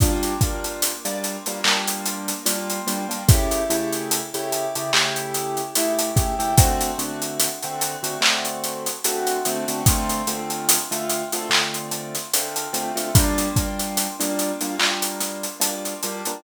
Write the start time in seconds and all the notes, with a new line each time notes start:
0.00 G3 A#3 D4 F4, kick, closed hi-hat
0.23 closed hi-hat
0.41 G3 A#3 D4 F4, kick, closed hi-hat
0.64 closed hi-hat
0.82 closed hi-hat
1.05 G3 A#3 D4 F4, closed hi-hat
1.24 closed hi-hat
1.46 G3 A#3 D4 F4, closed hi-hat
1.64 G3 A#3 D4 F4, clap
1.88 closed hi-hat
2.05 closed hi-hat
2.28 closed hi-hat
2.46 G3 A#3 D4 F4, closed hi-hat
2.70 closed hi-hat
2.87 G3 A#3 D4 F4, closed hi-hat
3.09 G3 A#3 D4 F4, closed hi-hat
3.28 C#3 A3 E4 G4, kick, closed hi-hat
3.51 closed hi-hat
3.70 C#3 A3 E4 G4, closed hi-hat
3.92 closed hi-hat
4.11 closed hi-hat
4.34 C#3 A3 E4 G4, closed hi-hat
4.52 closed hi-hat
4.75 C#3 A3 E4 G4, closed hi-hat
4.93 C#3 A3 E4 G4, clap
5.16 closed hi-hat
5.34 closed hi-hat
5.57 closed hi-hat
5.75 C#3 A3 E4 G4, closed hi-hat
5.99 closed hi-hat
6.16 C#3 A3 E4 G4, kick, closed hi-hat
6.39 C#3 A3 E4 G4, closed hi-hat
6.57 D3 A3 C4 F#4, kick, closed hi-hat
6.81 closed hi-hat
6.98 D3 A3 C4 F#4, closed hi-hat
7.22 closed hi-hat
7.40 closed hi-hat
7.63 D3 A3 C4 F#4, closed hi-hat
7.81 closed hi-hat
8.03 D3 A3 C4 F#4, closed hi-hat
8.21 D3 A3 C4 F#4, clap
8.45 closed hi-hat
8.64 closed hi-hat
8.86 closed hi-hat
9.04 D3 A3 C4 F#4, closed hi-hat
9.27 closed hi-hat
9.45 D3 A3 C4 F#4, closed hi-hat
9.68 D3 A3 C4 F#4, closed hi-hat
9.86 D3 A3 C4 F4, kick, closed hi-hat
10.09 closed hi-hat
10.27 D3 A3 C4 F4, closed hi-hat
10.50 closed hi-hat
10.69 closed hi-hat
10.91 D3 A3 C4 F4, closed hi-hat
11.09 closed hi-hat
11.32 D3 A3 C4 F4, closed hi-hat
11.49 D3 A3 C4 F4, clap
11.74 closed hi-hat
11.91 closed hi-hat
12.15 snare, closed hi-hat
12.34 D3 A3 C4 F4, closed hi-hat
12.56 closed hi-hat
12.73 D3 A3 C4 F4, closed hi-hat
12.96 D3 A3 C4 F4, closed hi-hat
13.15 G3 A#3 D4 F4, kick, closed hi-hat
13.38 closed hi-hat
13.56 G3 A#3 D4 F4, kick, closed hi-hat
13.79 closed hi-hat
13.97 closed hi-hat
14.20 G3 A#3 D4 F4, closed hi-hat
14.39 closed hi-hat
14.61 G3 A#3 D4 F4, closed hi-hat
14.79 G3 A#3 D4 F4, clap
15.02 closed hi-hat
15.20 snare, closed hi-hat
15.43 closed hi-hat
15.60 G3 A#3 D4 F4, closed hi-hat
15.85 closed hi-hat
16.03 G3 A#3 D4 F4, closed hi-hat
16.25 G3 A#3 D4 F4, closed hi-hat